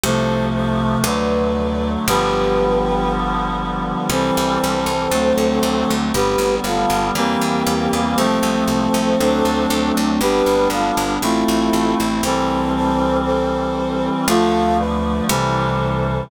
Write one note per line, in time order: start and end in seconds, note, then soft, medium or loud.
0.03 0.97 C2 medium
0.03 1.05 C3 medium
0.03 1.05 F3 medium
0.03 1.05 A3 medium
0.03 0.45 A4 loud
0.03 0.45 C5 loud
0.55 0.98 A4 medium
0.55 0.98 C5 medium
1.04 1.97 D2 medium
1.04 2.06 D3 medium
1.04 2.06 F#3 medium
1.04 2.06 A3 medium
1.04 1.90 B4 medium
1.04 1.90 D5 medium
2.08 3.95 G1 medium
2.08 4.09 D3 loud
2.08 4.09 F3 medium
2.08 4.09 G3 medium
2.08 4.09 B3 medium
2.08 3.12 G4 medium
2.08 3.12 B4 loud
4.10 4.31 C2 medium
4.10 5.11 E3 medium
4.10 5.11 G3 medium
4.10 5.11 C4 medium
4.10 5.94 A4 medium
4.10 5.94 C5 loud
4.37 4.59 C2 medium
4.64 4.85 C2 medium
4.86 5.08 C2 medium
5.11 5.33 D2 medium
5.11 6.13 D3 medium
5.11 6.13 F#3 medium
5.11 6.13 A3 medium
5.11 6.13 C4 medium
5.38 5.59 D2 medium
5.63 5.84 D2 medium
5.90 6.12 D2 medium
6.14 6.36 G1 medium
6.14 7.14 D3 medium
6.14 7.14 G3 medium
6.14 7.14 B3 medium
6.14 6.55 G4 medium
6.14 6.55 B4 loud
6.38 6.60 G1 medium
6.64 6.85 G1 medium
6.64 7.08 F4 medium
6.64 7.08 A4 medium
6.90 7.11 G1 medium
7.15 7.37 E2 medium
7.15 8.17 E3 loud
7.15 8.17 G3 medium
7.15 8.17 A#3 loud
7.15 8.17 C4 medium
7.15 8.01 G4 medium
7.15 8.01 A#4 loud
7.41 7.63 E2 medium
7.67 7.88 E2 medium
7.93 8.15 E2 medium
8.17 8.39 C2 medium
8.17 9.18 F3 medium
8.17 9.18 A3 medium
8.17 9.18 C4 medium
8.17 9.92 A4 medium
8.17 9.92 C5 loud
8.43 8.64 C2 medium
8.68 8.89 C2 medium
8.94 9.16 C2 medium
9.19 9.42 D2 medium
9.19 10.20 F#3 medium
9.19 10.20 A3 medium
9.19 10.20 C4 medium
9.19 10.20 D4 medium
9.45 9.67 D2 medium
9.70 9.92 D2 medium
9.97 10.19 D2 medium
10.21 10.42 G1 medium
10.21 11.22 G3 medium
10.21 11.22 B3 medium
10.21 11.22 D4 medium
10.21 10.68 G4 loud
10.21 10.68 B4 loud
10.46 10.68 G1 medium
10.70 10.92 G1 medium
10.70 11.13 F4 medium
10.70 11.13 A4 medium
10.97 11.19 G1 medium
11.22 11.44 A1 medium
11.22 12.23 A3 medium
11.22 12.23 C4 medium
11.22 12.23 E4 medium
11.22 11.97 F4 medium
11.22 11.97 A4 medium
11.48 11.70 A1 medium
11.73 11.95 A1 medium
12.00 12.21 A1 medium
12.23 14.10 C2 medium
12.23 14.26 E3 medium
12.23 14.26 G3 medium
12.23 14.26 C4 medium
12.23 12.73 A4 medium
12.23 12.73 C5 loud
12.76 13.17 A4 medium
12.76 13.17 C5 loud
13.25 14.08 A4 medium
13.25 14.08 C5 medium
14.28 15.21 D2 medium
14.28 15.29 D3 medium
14.28 15.29 F3 loud
14.28 15.29 A3 medium
14.28 14.77 F4 loud
14.28 14.77 A4 loud
14.79 15.23 B4 medium
14.79 15.23 D5 medium
15.29 16.23 C2 loud
15.29 16.30 C3 medium
15.29 16.30 E3 medium
15.29 16.30 G3 medium
15.29 16.24 A4 medium
15.29 16.24 C5 medium